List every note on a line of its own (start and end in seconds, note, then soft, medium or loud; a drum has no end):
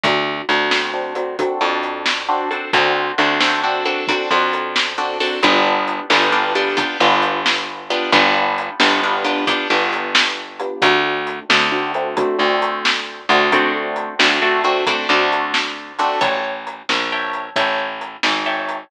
0.03 0.42 D2 loud
0.03 0.45 C4 medium
0.03 0.45 D4 medium
0.03 0.45 F#4 medium
0.03 0.45 A4 medium
0.03 kick medium
0.03 closed hi-hat medium
0.49 1.44 D2 medium
0.49 0.70 C4 medium
0.49 0.70 D4 medium
0.49 0.70 F#4 medium
0.49 0.70 A4 medium
0.49 closed hi-hat medium
0.70 0.91 C4 medium
0.70 0.91 D4 medium
0.70 0.91 F#4 medium
0.70 0.91 A4 medium
0.70 snare medium
0.94 1.14 C4 medium
0.94 1.14 D4 medium
0.94 1.14 F#4 medium
0.94 1.14 A4 medium
1.15 1.36 C4 medium
1.15 1.36 D4 medium
1.15 1.36 F#4 medium
1.15 1.36 A4 medium
1.15 closed hi-hat medium
1.39 1.60 C4 medium
1.39 1.60 D4 medium
1.39 1.60 F#4 medium
1.39 1.60 A4 medium
1.39 kick medium
1.39 closed hi-hat medium
1.61 2.56 F2 medium
1.61 2.23 C4 medium
1.61 2.23 D4 medium
1.61 2.23 F#4 medium
1.61 2.23 A4 medium
1.83 closed hi-hat medium
2.06 snare medium
2.29 2.49 C4 medium
2.29 2.49 D4 medium
2.29 2.49 F#4 medium
2.29 2.49 A4 medium
2.51 2.71 C4 medium
2.51 2.71 D4 medium
2.51 2.71 F#4 medium
2.51 2.71 A4 medium
2.51 closed hi-hat medium
2.73 3.12 D2 loud
2.73 3.15 C4 medium
2.73 3.15 D4 medium
2.73 3.15 F#4 medium
2.73 3.15 A4 medium
2.73 kick medium
2.73 closed hi-hat medium
3.18 4.14 D2 medium
3.18 3.39 C4 medium
3.18 3.39 D4 medium
3.18 3.39 F#4 medium
3.18 3.39 A4 medium
3.18 closed hi-hat medium
3.40 3.61 C4 medium
3.40 3.61 D4 medium
3.40 3.61 F#4 medium
3.40 3.61 A4 medium
3.40 snare medium
3.64 3.84 C4 medium
3.64 3.84 D4 medium
3.64 3.84 F#4 medium
3.64 3.84 A4 medium
3.85 4.06 C4 medium
3.85 4.06 D4 medium
3.85 4.06 F#4 medium
3.85 4.06 A4 medium
3.85 closed hi-hat medium
4.07 4.29 C4 medium
4.07 4.29 D4 medium
4.07 4.29 F#4 medium
4.07 4.29 A4 medium
4.07 kick medium
4.07 closed hi-hat medium
4.31 5.26 F2 medium
4.31 4.93 C4 medium
4.31 4.93 D4 medium
4.31 4.93 F#4 medium
4.31 4.93 A4 medium
4.53 closed hi-hat medium
4.76 snare medium
4.98 5.19 C4 medium
4.98 5.19 D4 medium
4.98 5.19 F#4 medium
4.98 5.19 A4 medium
5.20 5.41 C4 medium
5.20 5.41 D4 medium
5.20 5.41 F#4 medium
5.20 5.41 A4 medium
5.20 open hi-hat medium
5.43 6.00 G1 loud
5.43 6.06 B3 medium
5.43 6.06 D4 medium
5.43 6.06 F4 medium
5.43 6.06 G4 medium
5.43 kick medium
5.43 closed hi-hat medium
5.88 closed hi-hat medium
6.10 6.87 G1 loud
6.10 6.31 B3 medium
6.10 6.31 D4 medium
6.10 6.31 F4 medium
6.10 6.31 G4 medium
6.10 snare medium
6.32 6.53 B3 medium
6.32 6.53 D4 medium
6.32 6.53 F4 medium
6.32 6.53 G4 medium
6.55 6.76 B3 medium
6.55 6.76 D4 medium
6.55 6.76 F4 medium
6.55 6.76 G4 medium
6.55 closed hi-hat medium
6.77 6.97 B3 medium
6.77 6.97 D4 medium
6.77 6.97 F4 medium
6.77 6.97 G4 medium
6.77 kick medium
6.77 closed hi-hat medium
7.00 7.96 G1 loud
7.00 7.83 B3 medium
7.00 7.83 D4 medium
7.00 7.83 F4 medium
7.00 7.83 G4 medium
7.22 closed hi-hat medium
7.46 snare medium
7.90 8.11 B3 medium
7.90 8.11 D4 medium
7.90 8.11 F4 medium
7.90 8.11 G4 medium
7.90 closed hi-hat medium
8.12 8.70 G1 loud
8.12 8.75 B3 loud
8.12 8.75 D4 medium
8.12 8.75 F4 medium
8.12 8.75 G4 medium
8.12 kick medium
8.12 closed hi-hat medium
8.58 closed hi-hat medium
8.80 9.57 G1 medium
8.80 9.00 B3 medium
8.80 9.00 D4 medium
8.80 9.00 F4 medium
8.80 9.00 G4 medium
8.80 snare medium
9.03 9.24 B3 medium
9.03 9.24 D4 medium
9.03 9.24 F4 medium
9.03 9.24 G4 medium
9.25 9.45 B3 medium
9.25 9.45 D4 medium
9.25 9.45 F4 medium
9.25 9.45 G4 medium
9.25 closed hi-hat medium
9.47 9.68 B3 medium
9.47 9.68 D4 medium
9.47 9.68 F4 medium
9.47 9.68 G4 medium
9.47 kick medium
9.47 closed hi-hat medium
9.70 10.66 G1 medium
9.70 10.53 B3 medium
9.70 10.53 D4 medium
9.70 10.53 F4 medium
9.70 10.53 G4 medium
9.93 closed hi-hat medium
10.15 snare loud
10.60 10.81 B3 medium
10.60 10.81 D4 medium
10.60 10.81 F4 medium
10.60 10.81 G4 medium
10.60 closed hi-hat medium
10.82 11.40 D2 loud
10.82 11.45 A3 medium
10.82 11.45 C4 medium
10.82 11.45 D4 medium
10.82 11.45 F#4 medium
10.82 kick medium
10.82 closed hi-hat loud
11.27 closed hi-hat medium
11.49 12.26 D2 loud
11.49 11.70 A3 medium
11.49 11.70 C4 medium
11.49 11.70 D4 medium
11.49 11.70 F#4 medium
11.49 snare loud
11.72 11.92 A3 medium
11.72 11.92 C4 medium
11.72 11.92 D4 medium
11.72 11.92 F#4 medium
11.94 12.16 A3 medium
11.94 12.16 C4 medium
11.94 12.16 D4 medium
11.94 12.16 F#4 medium
11.94 closed hi-hat medium
12.17 12.38 A3 medium
12.17 12.38 C4 medium
12.17 12.38 D4 medium
12.17 12.38 F#4 medium
12.17 kick medium
12.17 closed hi-hat medium
12.38 13.25 D2 medium
12.38 13.21 A3 medium
12.38 13.21 C4 medium
12.38 13.21 D4 medium
12.38 13.21 F#4 medium
12.62 closed hi-hat medium
12.85 snare medium
13.29 14.09 D2 loud
13.29 13.51 A3 medium
13.29 13.51 C4 medium
13.29 13.51 D4 medium
13.29 13.51 F#4 medium
13.29 closed hi-hat medium
13.52 14.15 A3 medium
13.52 14.15 C4 medium
13.52 14.15 D4 medium
13.52 14.15 F#4 medium
13.52 kick medium
13.52 closed hi-hat medium
13.96 closed hi-hat medium
14.19 14.96 D2 medium
14.19 14.40 A3 medium
14.19 14.40 C4 medium
14.19 14.40 D4 medium
14.19 14.40 F#4 medium
14.19 snare loud
14.42 14.63 A3 medium
14.42 14.63 C4 medium
14.42 14.63 D4 medium
14.42 14.63 F#4 medium
14.64 14.85 A3 medium
14.64 14.85 C4 medium
14.64 14.85 D4 medium
14.64 14.85 F#4 medium
14.64 closed hi-hat medium
14.87 15.08 A3 medium
14.87 15.08 C4 medium
14.87 15.08 D4 medium
14.87 15.08 F#4 medium
14.87 kick medium
14.87 closed hi-hat medium
15.09 16.05 D2 loud
15.09 15.92 A3 medium
15.09 15.92 C4 medium
15.09 15.92 D4 medium
15.09 15.92 F#4 medium
15.32 closed hi-hat medium
15.54 snare medium
15.99 16.20 A3 medium
15.99 16.20 C4 medium
15.99 16.20 D4 medium
15.99 16.20 F#4 medium
15.99 closed hi-hat medium
16.21 16.82 A1 medium
16.21 16.52 C#5 medium
16.21 16.52 E5 medium
16.21 16.52 G5 medium
16.21 16.52 A5 medium
16.21 kick medium
16.21 closed hi-hat medium
16.67 closed hi-hat medium
16.89 17.50 A#1 medium
16.89 snare medium
17.12 17.44 C#5 medium
17.12 17.44 E5 medium
17.12 17.44 G5 medium
17.12 17.44 A5 medium
17.33 closed hi-hat soft
17.56 18.17 A1 medium
17.56 17.88 C#5 medium
17.56 17.88 E5 medium
17.56 17.88 G5 medium
17.56 17.88 A5 medium
17.56 kick medium
17.56 closed hi-hat medium
18.01 closed hi-hat medium
18.23 18.84 G#1 medium
18.23 snare medium
18.46 18.78 C#5 medium
18.46 18.78 E5 medium
18.46 18.78 G5 medium
18.46 18.78 A5 medium
18.69 closed hi-hat medium